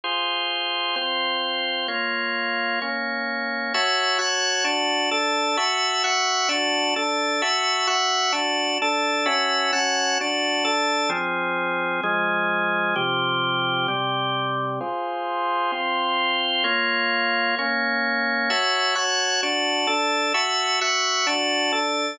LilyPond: \new Staff { \time 4/4 \key f \minor \tempo 4 = 130 <f' aes' c''>2 <c' f' c''>2 | <bes f' des''>2 <bes des' des''>2 | \key fis \minor <fis' cis'' e'' a''>4 <fis' cis'' fis'' a''>4 <d' fis' a''>4 <d' a' a''>4 | <fis' e'' a'' cis'''>4 <fis' e'' fis'' cis'''>4 <d' fis' a''>4 <d' a' a''>4 |
<fis' e'' a'' cis'''>4 <fis' e'' fis'' cis'''>4 <d' fis' a''>4 <d' a' a''>4 | <cis' fis' e'' a''>4 <cis' fis' fis'' a''>4 <d' fis' a''>4 <d' a' a''>4 | \key f \minor <f c' aes'>2 <f aes aes'>2 | <c f g'>2 <c g g'>2 |
<f' aes' c''>2 <c' f' c''>2 | <bes f' des''>2 <bes des' des''>2 | \key fis \minor <fis' cis'' e'' a''>4 <fis' cis'' fis'' a''>4 <d' fis' a''>4 <d' a' a''>4 | <fis' e'' a'' cis'''>4 <fis' e'' fis'' cis'''>4 <d' fis' a''>4 <d' a' a''>4 | }